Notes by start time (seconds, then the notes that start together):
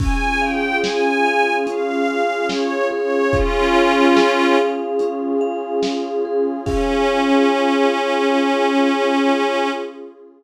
0.00 C#4 F4 G#4 G#5, kick, crash
0.40 F5 G5
0.83 G#4 G#5, snare
1.26 F5
1.67 C#4 F5, closed hi-hat
2.08 F5
2.49 C#5 F5, snare
2.91 G#4 C#5
3.32 C#4 F4, kick, closed hi-hat
3.76 F5
4.16 G#4, snare
4.59 F5
4.99 C#4, closed hi-hat
5.41 F5
5.83 F5, snare
6.25 G#4
6.66 C#4 F4 G#4 F5, kick, crash